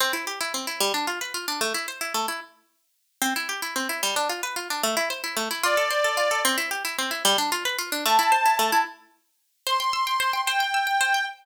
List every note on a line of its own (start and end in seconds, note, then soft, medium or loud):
0.00 0.13 C4 loud
0.13 0.25 E4 medium
0.27 0.39 G4 medium
0.41 0.53 E4 medium
0.54 0.66 C4 medium
0.67 0.79 E4 medium
0.80 0.93 G3 loud
0.94 1.06 D4 medium
1.07 1.19 F4 medium
1.21 1.33 B4 medium
1.34 1.46 F4 medium
1.48 1.60 D4 medium
1.61 1.73 A3 medium
1.74 1.86 E4 medium
1.88 2.00 C5 medium
2.01 2.13 E4 medium
2.14 2.26 A3 medium
2.28 2.40 E4 medium
3.22 3.34 C4 loud
3.36 3.48 E4 medium
3.49 3.61 G4 medium
3.62 3.74 E4 medium
3.76 3.88 C4 medium
3.89 4.01 E4 medium
4.03 4.15 G3 medium
4.16 4.28 D4 medium
4.29 4.42 F4 medium
4.43 4.55 B4 medium
4.56 4.68 F4 medium
4.70 4.82 D4 medium
4.83 4.95 A3 loud
4.97 5.09 E4 medium
5.10 5.22 C5 medium
5.24 5.36 E4 medium
5.37 5.49 A3 medium
5.51 5.63 E4 medium
5.63 5.76 F4 loud
5.63 6.41 D5 medium
5.77 5.89 A4 medium
5.90 6.03 C5 medium
6.04 6.16 A4 medium
6.17 6.29 F4 medium
6.31 6.43 A4 medium
6.45 6.57 C4 loud
6.58 6.70 E4 medium
6.71 6.83 G4 medium
6.85 6.97 E4 medium
6.98 7.11 C4 medium
7.11 7.23 E4 medium
7.25 7.37 G3 loud
7.38 7.50 D4 medium
7.52 7.64 F4 medium
7.65 7.77 B4 medium
7.79 7.91 F4 medium
7.92 8.04 D4 medium
8.05 8.18 A3 loud
8.05 8.78 A5 medium
8.19 8.31 E4 medium
8.32 8.44 C5 medium
8.46 8.58 E4 medium
8.59 8.71 A3 loud
8.72 8.84 E4 medium
9.67 9.79 C5 loud
9.67 10.41 C6 medium
9.80 9.92 G5 medium
9.93 10.05 E6 medium
10.07 10.19 G5 medium
10.20 10.32 C5 medium
10.33 10.45 G5 medium
10.46 10.59 C5 loud
10.46 11.25 G5 medium
10.60 10.72 G5 medium
10.74 10.86 E6 medium
10.87 10.99 G5 medium
11.01 11.13 C5 medium
11.14 11.26 G5 medium